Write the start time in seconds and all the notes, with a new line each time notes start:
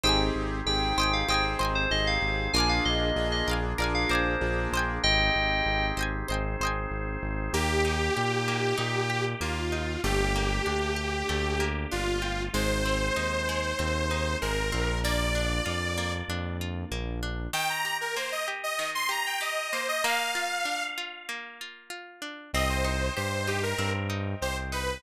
0.04 G#1 C4 D#4 G4 G#4 C5 D#5 G5
0.09 G#5
0.35 G#1
0.66 G#1 C4 D#4 G4 G#4 G5
0.97 G#1 C5 D#5 G5
1.01 G5 G#5
1.13 F5
1.28 G#1 C4 D#4 G4 G#4 C5 D#5 G5
1.34 G#5
1.59 G#1 C5 D#5 G5
1.65 G#5
1.75 C5
1.91 G#1 C4 D#4 G4 G#4 D#5
2.07 F5
2.22 G#1
2.53 A#1 A#3 D4 F4 G#4 A#4 D5 G#5
2.58 F5 G#5
2.69 F5
2.85 A#1 D#5
3.16 A#1 A#3 D4 F4 G#4
3.32 D#5
3.47 A#1 A#4 D5 F5
3.53 G#5
3.78 A#1 A#3 D4 F4 G#4 A#4 D5 F5
3.84 G#5
3.95 F5
4.09 A#1 A#4 C5 D5 F5
4.15 G#5
4.41 A#1 A#3 D4 F4 G#4
4.72 A#1 C5 D#5
4.77 G5 G#5
5.03 G#1 C4 D#4 G4 G#4 D#5 G5
5.35 G#1
5.66 G#1
5.97 G#1 C5 D#5 G5
6.02 G#5
6.28 G#1 C4 D#4 G#4 C5 D#5 G5
6.34 G#5
6.60 G#1 C5 D#5
6.65 G5 G#5
6.91 G#1
7.23 G#1
7.53 D#2 A#3 D#4 G4
7.85 D#4
8.17 A#2 G4
8.48 A#3
8.78 A#2 D#4
9.10 G4
9.41 D#2 A#3 F4
9.72 D#4
10.04 G1 A3 A#3 D4 G4
10.36 A#3
10.66 D2 D4
10.96 G4
11.29 D2 A3
11.60 A#3
11.91 G1 D4 F4
12.22 G4
12.53 G#1 G#3 C4 D#4 C5
12.85 C4
13.16 D#2 D#4
13.49 G#3
13.79 D#2 C4
14.11 D#4
14.41 G#1 G#3 A#4
14.72 A#1 A#3 C4 D4 F4
15.04 A#3 D5
15.35 D4
15.66 F2 F4
15.98 A#3
16.29 F2 D4
16.61 F4
16.91 A#1 A#3
17.23 D4
17.53 D#3 G5
17.70 A#5
17.85 G4
18.01 A#4
18.16 A#3 C5
18.32 D#5
18.48 G4
18.63 D#5
18.79 D#3
18.95 C6
19.09 G4 A#5
19.26 G5
19.41 G4 D#5
19.72 A#3 C5
19.88 D#5
20.04 A#3 F5
20.35 F4
20.65 D4
20.98 F4
21.29 A#3
21.61 F4
21.90 F4
22.22 D4
22.53 C2 C4 C5 D#5 G5
22.69 C5
22.84 D#4
23.17 G2 G4 C5
23.47 D#4 G4
23.63 A#4
23.78 G2 C4
24.10 D#4
24.42 C2 G4 C5
24.72 D#4 B4